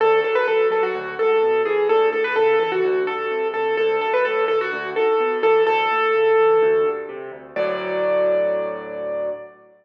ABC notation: X:1
M:4/4
L:1/16
Q:1/4=127
K:D
V:1 name="Acoustic Grand Piano"
A2 A B A2 A F3 A4 ^G2 | A2 A B A2 A F3 A4 A2 | A2 A B A2 A F3 A4 A2 | A12 z4 |
d16 |]
V:2 name="Acoustic Grand Piano" clef=bass
D,,2 F,2 F,2 F,2 D,,2 ^G,,2 B,,2 E,2 | D,,2 A,,2 C,2 E,2 D,,2 G,,2 =C,2 D,,2 | D,,2 F,,2 A,,2 D,,2 D,,2 ^G,,2 B,,2 E,2 | D,,2 A,,2 C,2 E,2 D,,2 G,,2 =C,2 D,,2 |
[D,,A,,F,]16 |]